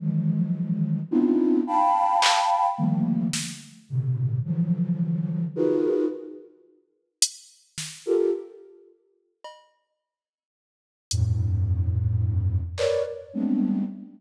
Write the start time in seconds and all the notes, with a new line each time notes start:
0.00 D#3 E3 F3 F#3 G#3
1.11 B3 C4 D4 D#4 E4 F4
1.67 F5 G5 A5 B5
2.22 clap
2.78 D3 D#3 F3 G3 A3 A#3
3.33 snare
3.89 A2 B2 C3 D3
4.44 D3 E3 F3 F#3
5.56 D#4 F4 F#4 G#4 A#4 B4
7.22 closed hi-hat
7.78 snare
8.06 F4 G4 A4 A#4
9.44 cowbell
11.11 F2 G2 A2, closed hi-hat
12.78 A#4 B4 C#5 D5, clap
13.33 G3 G#3 A3 B3 C4 D4